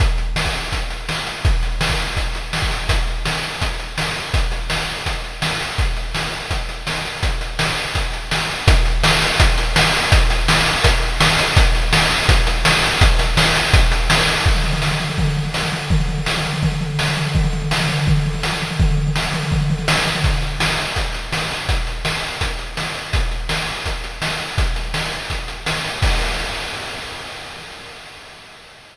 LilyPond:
\new DrumStaff \drummode { \time 4/4 \tempo 4 = 166 <hh bd>8 hh8 sn16 bd16 hh8 <hh bd>8 hh8 sn8 hh8 | <hh bd>8 hh8 sn16 bd16 hh8 <hh bd>8 hh8 sn16 bd16 hh8 | <hh bd>8 hh8 sn8 hh8 <hh bd>8 hh8 sn8 hho8 | <hh bd>8 hh8 sn8 hh8 <hh bd>8 hh8 sn8 hh8 |
<hh bd>8 hh8 sn8 hh8 <hh bd>8 hh8 sn8 hh8 | <hh bd>8 hh8 sn8 hh8 <hh bd>8 hh8 sn8 hh8 | <hh bd>8 hh8 sn8 hh8 <hh bd>8 hh8 sn8 hho8 | <hh bd>8 hh8 sn8 hh8 <hh bd>8 hh8 sn8 hh8 |
<hh bd>8 hh8 sn8 hh8 <hh bd>8 hh8 sn8 hh8 | <hh bd>8 hh8 sn8 hh8 <hh bd>8 hh8 sn8 hh8 | <cymc bd>16 tomfh16 tomfh16 tomfh16 sn16 tomfh16 tomfh16 tomfh16 <bd tomfh>16 tomfh16 tomfh16 tomfh16 sn16 tomfh16 tomfh8 | <bd tomfh>16 tomfh16 tomfh16 tomfh16 sn16 tomfh16 tomfh16 tomfh16 <bd tomfh>16 tomfh16 tomfh16 tomfh16 sn16 tomfh16 tomfh16 tomfh16 |
<bd tomfh>16 tomfh16 tomfh16 tomfh16 sn16 tomfh16 tomfh16 tomfh16 <bd tomfh>16 tomfh16 tomfh16 tomfh16 sn16 tomfh16 tomfh16 tomfh16 | <bd tomfh>16 tomfh16 tomfh16 tomfh16 sn16 tomfh16 tomfh16 tomfh16 <bd tomfh>16 tomfh16 tomfh16 tomfh16 sn16 tomfh16 tomfh16 tomfh16 | <hh bd>8 hh8 sn8 hh8 <hh bd>8 hh8 sn8 hho8 | <hh bd>8 hh8 sn8 hh8 <hh bd>8 hh8 sn8 hh8 |
<hh bd>8 hh8 sn8 hh8 <hh bd>8 hh8 sn8 hh8 | <hh bd>8 hh8 sn8 hh8 <hh bd>8 hh8 sn8 hho8 | <cymc bd>4 r4 r4 r4 | }